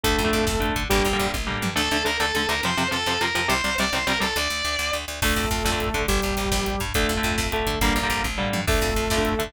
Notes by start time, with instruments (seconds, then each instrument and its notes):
0.03 electric bass (finger) D2, overdriven guitar D3 A3, lead 2 (sawtooth) A3 A4, kick, closed hi-hat
0.11 kick
0.18 electric bass (finger) F2, kick, closed hi-hat
0.24 overdriven guitar D3 A3, kick
0.33 electric bass (finger) F2, kick, closed hi-hat
0.40 kick
0.47 electric bass (finger) F2, kick, snare
0.54 kick
0.60 overdriven guitar D3 A3, kick, closed hi-hat
0.69 kick
0.76 electric bass (finger) D3, kick, closed hi-hat
0.83 kick
0.89 electric bass (finger) G1, overdriven guitar D3 G3 A#3, lead 2 (sawtooth) G3 G4, kick, closed hi-hat
0.98 kick
1.05 electric bass (finger) A#1, kick, closed hi-hat
1.13 overdriven guitar D3 G3 A#3, kick
1.20 electric bass (finger) A#1, kick, closed hi-hat
1.27 kick
1.33 electric bass (finger) A#1, kick, high tom
1.47 overdriven guitar D3 G3 A#3, floor tom
1.62 electric bass (finger) G2, mid tom
1.75 electric bass (finger) D2, overdriven guitar D3 A3, distortion guitar A4
1.91 electric bass (finger) D2, overdriven guitar D3 A3
2.05 electric bass (finger) D2, overdriven guitar D3 A3, distortion guitar A#4
2.20 electric bass (finger) D2, overdriven guitar D3 A3, distortion guitar A4
2.35 electric bass (finger) D2, overdriven guitar D3 A3, distortion guitar A4
2.49 electric bass (finger) D2, overdriven guitar D3 A3, distortion guitar A#4
2.63 electric bass (finger) F2, overdriven guitar C3 F3, distortion guitar C5
2.77 electric bass (finger) F2, overdriven guitar C3 F3
2.91 electric bass (finger) F2, overdriven guitar C3 F3, distortion guitar A4
3.06 electric bass (finger) F2, overdriven guitar C3 F3
3.21 electric bass (finger) F2, overdriven guitar C3 F3, distortion guitar A#4
3.35 electric bass (finger) F2, overdriven guitar C3 F3
3.48 electric bass (finger) C2, overdriven guitar C3 G3, distortion guitar C5
3.64 electric bass (finger) C2, overdriven guitar C3 G3
3.78 electric bass (finger) C2, overdriven guitar C3 G3, distortion guitar D5
3.93 electric bass (finger) C2, overdriven guitar C3 G3, distortion guitar C5
4.07 electric bass (finger) C2, overdriven guitar C3 G3, distortion guitar A#4
4.20 electric bass (finger) C2, overdriven guitar C3 G3, distortion guitar A4
4.36 electric bass (finger) D2, distortion guitar D5
4.50 electric bass (finger) D2
4.65 electric bass (finger) D2
4.79 electric bass (finger) D2
4.93 electric bass (finger) D2
5.08 electric bass (finger) D2
5.22 electric bass (finger) D2, overdriven guitar D3 A3, lead 2 (sawtooth) A3 A4, kick, crash
5.29 kick
5.36 electric bass (finger) F2, kick, closed hi-hat
5.44 kick
5.51 electric bass (finger) F2, kick, closed hi-hat
5.58 kick
5.65 electric bass (finger) F2, overdriven guitar D3 A3, kick, snare
5.72 overdriven guitar D3 A3, kick
5.80 kick, closed hi-hat
5.87 kick
5.94 electric bass (finger) D3, overdriven guitar D3 A3, kick, closed hi-hat
6.01 kick
6.08 electric bass (finger) G1, lead 2 (sawtooth) G3 G4, kick, closed hi-hat
6.16 kick
6.22 electric bass (finger) A#1, kick, closed hi-hat
6.31 kick
6.37 electric bass (finger) A#1, kick, closed hi-hat
6.45 kick
6.51 electric bass (finger) A#1, kick, snare
6.59 kick
6.66 kick, closed hi-hat
6.74 kick
6.80 electric bass (finger) G2, kick, closed hi-hat
6.88 kick
6.94 electric bass (finger) D2, overdriven guitar D3 A3, lead 2 (sawtooth) A3 A4, kick, closed hi-hat
7.02 kick
7.09 electric bass (finger) F2, kick, closed hi-hat
7.16 overdriven guitar D3 A3, kick
7.23 electric bass (finger) F2, kick, closed hi-hat
7.31 kick
7.38 electric bass (finger) F2, kick, snare
7.45 kick
7.52 overdriven guitar D3 A3, lead 2 (sawtooth) A3 A4, kick, closed hi-hat
7.59 kick
7.67 electric bass (finger) D3, kick, closed hi-hat
7.74 kick
7.81 electric bass (finger) G1, overdriven guitar D3 G3 A#3, lead 2 (sawtooth) A#3 A#4, kick, closed hi-hat
7.88 kick
7.96 electric bass (finger) A#1, kick, closed hi-hat
8.03 overdriven guitar D3 G3 A#3, kick
8.10 electric bass (finger) A#1, kick, closed hi-hat
8.17 kick
8.24 electric bass (finger) A#1, kick, high tom
8.38 overdriven guitar D3 G3 A#3, floor tom
8.53 electric bass (finger) G2, mid tom
8.67 electric bass (finger) D2, overdriven guitar D3 A3, lead 2 (sawtooth) A3 A4, kick, crash
8.74 kick
8.81 electric bass (finger) F2, kick, closed hi-hat
8.88 kick
8.96 electric bass (finger) F2, kick, closed hi-hat
9.04 kick
9.10 electric bass (finger) F2, overdriven guitar D3 A3, kick, snare
9.17 overdriven guitar D3 A3, kick
9.25 kick, closed hi-hat
9.32 kick
9.39 overdriven guitar D3 A3, electric bass (finger) D3, kick, closed hi-hat
9.47 kick